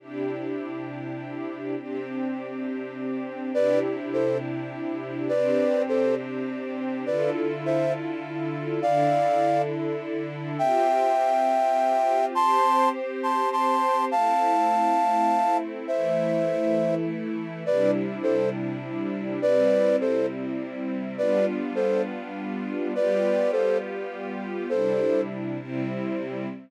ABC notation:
X:1
M:6/8
L:1/8
Q:3/8=68
K:C
V:1 name="Flute"
z6 | z6 | [Bd] z [Ac] z3 | [Bd]2 [Ac] z3 |
[Bd] z [ce] z3 | [df]3 z3 | [eg]6 | [ac']2 z [ac'] [ac']2 |
[fa]6 | [ce]4 z2 | [Bd] z [Ac] z3 | [Bd]2 [Ac] z3 |
[Bd] z [Ac] z3 | [Bd]2 [Ac] z3 | [Ac]2 z4 |]
V:2 name="String Ensemble 1"
[C,DEG]6 | [C,CDG]6 | [C,DEG]6 | [C,CDG]6 |
[D,EFA]6 | [D,DEA]6 | [CFG]6 | [CGc]6 |
[A,CE]6 | [E,A,E]6 | [C,G,DE]6 | [C,G,CE]6 |
[G,B,DF]6 | [G,B,FG]6 | [C,G,DE]3 [C,G,CE]3 |]